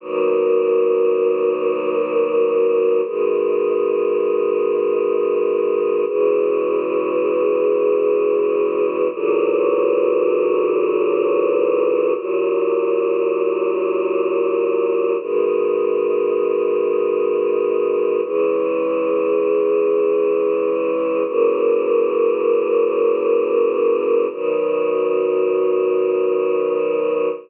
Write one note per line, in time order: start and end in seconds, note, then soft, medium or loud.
0.00 3.01 B2 loud
0.00 3.01 D#3 loud
0.00 3.01 F#3 loud
0.00 3.01 A#3 medium
3.04 6.05 B2 loud
3.04 6.05 D#3 medium
3.04 6.05 G#3 loud
6.08 9.08 B2 medium
6.08 9.08 C#3 loud
6.08 9.08 E3 loud
6.08 9.08 G#3 medium
9.12 12.13 B1 loud
9.12 12.13 A#2 loud
9.12 12.13 C#3 loud
9.12 12.13 E3 medium
9.12 12.13 F#3 loud
12.15 15.16 D#2 medium
12.15 15.16 A#2 loud
12.15 15.16 F#3 medium
15.20 18.21 B2 loud
15.20 18.21 D#3 medium
15.20 18.21 G#3 medium
18.23 21.24 C#3 loud
18.23 21.24 E3 loud
18.23 21.24 G#3 medium
21.26 24.27 F#2 loud
21.26 24.27 C#3 medium
21.26 24.27 E3 medium
21.26 24.27 A#3 loud
24.31 27.29 B2 loud
24.31 27.29 D#3 medium
24.31 27.29 F#3 loud